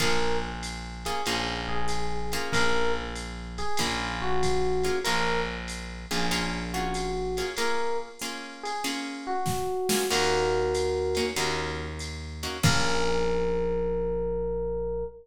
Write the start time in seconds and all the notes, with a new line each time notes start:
0.00 A#1 A#3 C#4 F4 G#4 A#4, kick, ride
0.63 hi-hat pedal, ride
1.05 A#3 C#4 F4 G#4, ride
1.26 A#1 A#3 C#4 F4 G#4, ride
1.69 G#4
1.88 hi-hat pedal, ride
2.32 A#3 C#4 F4 G#4, ride
2.53 A#1 A#4, kick, ride
3.15 hi-hat pedal, ride
3.58 G#4, ride
3.77 A#1 A#3 C#4 F4 G#4, kick, ride
4.22 F#4
4.43 kick, hi-hat pedal, ride
4.83 A#3 C#4 F4 G#4, ride
5.04 A#1 A#3 C#4 F4 G#4 A#4, ride
5.68 hi-hat pedal, ride
6.11 A#1 A#3 C#4 F4 G#4, ride
6.31 A#3 C#4 F4 G#4, ride
6.74 A#3 C#4 F4 F#4 G#4
6.94 hi-hat pedal, ride
7.37 A#3 C#4 F4 G#4, ride
7.57 A#3 C#4 F4 G#4 A#4, ride
8.19 A#3 C#4 F4 G#4, hi-hat pedal, ride
8.63 G#4, ride
8.84 A#3 C#4 F4 G#4, ride
9.27 F#4
9.46 kick, snare
9.89 A#3 C#4 F4 G#4, snare
10.10 D#2 A#3 C#4 D#4 F#4 A#4, crash, ride
10.74 hi-hat pedal, ride
11.15 A#3 C#4 D#4 F#4, ride
11.36 D#2 A#3 C#4 D#4 F#4, ride
11.99 hi-hat pedal, ride
12.43 A#3 C#4 D#4 F#4, ride
12.63 A#1 A#3 C#4 F4 G#4 A#4, kick, crash